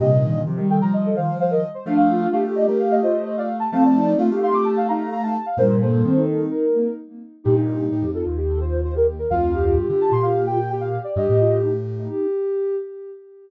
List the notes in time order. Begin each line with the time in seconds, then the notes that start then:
0.00 G2 A#2 C3 G4 D#5
0.11 D#4
0.23 D#3
0.35 D#3
0.46 C3 F3 G4
0.57 D#3 G3
0.70 A4 G5
0.82 F3 A#5
0.93 D#5
1.05 A4
1.16 D#3 C5 F5
1.40 C5 F5
1.51 A#4 D#5
1.74 C5
1.86 F3 A3 D4 F5
1.97 F5
2.09 F4
2.21 F4
2.31 A3 G4 F5
2.44 A3 G4
2.55 D5 D#5
2.67 A3 A#4
2.79 F5
2.91 D#5
3.02 F4 C5 D#5
3.25 C5 D#5
3.37 D5 F5
3.60 A5
3.72 F3 A3 C4 F5 A5
3.85 D5
3.95 D#4
4.06 D#4
4.18 A3 F4 F5
4.30 A3 G4
4.42 F5 C6
4.53 A3 D6
4.65 A5
4.76 F5
4.88 D#4 F5 A#5
5.10 F5 A#5
5.23 F5 A5
5.46 F5
5.57 G2 A#2 G3 A#4 C5
5.81 A#3 A4 C5
5.93 A#3
6.04 D#3 C4
6.16 D#4
6.51 A#4
6.74 A#3
7.44 G2 A#2 D#4 G4
7.55 D#4
7.91 A2 G4
8.02 F2
8.14 F4 A4
8.25 D#2 F4
8.37 G4
8.49 A4
8.60 F4 C5
8.83 F4 C5
8.95 G4 A#4
9.19 A#4
9.30 D2 F2 F4 F5
9.54 G4
9.65 G4
9.76 G2 G4
9.88 D3 G4
10.01 A5
10.11 A#2 C6
10.22 F5
10.46 G4 G5
10.69 G4 G5
10.81 F5
11.04 D5
11.16 G2 G4 D#5
11.28 A2 G4
11.40 F4
11.63 D#4
11.99 D#4
12.09 G4